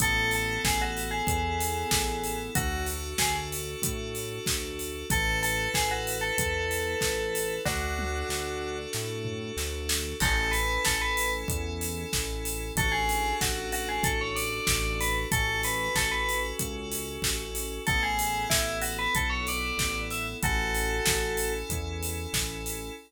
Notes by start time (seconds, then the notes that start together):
0.00 A1 B3 E4 A4, kick, closed hi-hat
0.31 A4, open hi-hat
0.64 A1 G#4, kick, snare
0.82 F#4
0.97 open hi-hat
1.11 G#4
1.27 E2, kick, closed hi-hat
1.61 open hi-hat
1.91 A1, kick, snare
2.24 open hi-hat
2.55 D2 D4 F#4 A4, kick, closed hi-hat
2.87 open hi-hat
3.18 D2 G#4, kick, snare
3.52 open hi-hat
3.82 A2, kick, closed hi-hat
4.15 open hi-hat
4.46 D2, kick, snare
4.79 open hi-hat
5.10 A1 E4 A4 B4, kick, closed hi-hat
5.43 A4, open hi-hat
5.73 A1 G#4, kick, snare
5.91 F#4
6.07 open hi-hat
6.21 A4
6.38 E2, kick, closed hi-hat
6.71 open hi-hat
7.01 A1, kick, snare
7.35 open hi-hat
7.65 D2 D4 F#4 A4, kick, snare
7.99 high tom
8.29 D2, snare
8.93 A2, snare
9.25 floor tom
9.57 D2, snare
9.89 snare
10.20 A1 C#4 E4 A4, kick, crash
10.51 B4, open hi-hat
10.85 A1 A4, kick, snare
11.01 B4
11.17 open hi-hat
11.48 E2, kick, closed hi-hat
11.81 open hi-hat
12.13 A1, kick, snare
12.45 open hi-hat
12.76 A1 D4 F#4 A4, kick, closed hi-hat
12.92 G#4
13.09 open hi-hat
13.41 A1 F#4, kick, snare
13.72 F#4, open hi-hat
13.89 G#4
14.03 A1 A4, kick, closed hi-hat
14.21 C#5
14.36 D5, open hi-hat
14.67 A1, kick, snare
15.01 B4, open hi-hat
15.32 A1 C#4 F#4 A4, kick, closed hi-hat
15.63 B4, open hi-hat
15.95 A1 A4, kick, snare
16.11 B4
16.29 open hi-hat
16.59 C#2, kick, closed hi-hat
16.92 open hi-hat
17.22 A1, kick, snare
17.55 open hi-hat
17.87 A1 B3 E4 A4, kick, closed hi-hat
18.03 G#4
18.19 open hi-hat
18.50 A1 E4, kick, snare
18.82 F#4, open hi-hat
18.99 B4
19.14 B1 A4, kick, closed hi-hat
19.30 C#5
19.47 D5, open hi-hat
19.77 A1, kick, snare
20.11 E5, open hi-hat
20.42 A1 C#4 E4 F#4 A4, kick, closed hi-hat
20.75 open hi-hat
21.06 A1, kick, snare
21.37 open hi-hat
21.69 E2, kick, closed hi-hat
22.03 open hi-hat
22.33 A1, kick, snare
22.66 open hi-hat